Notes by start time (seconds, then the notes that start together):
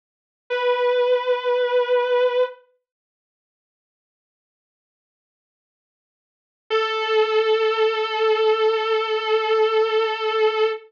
0.50 B4
6.70 A4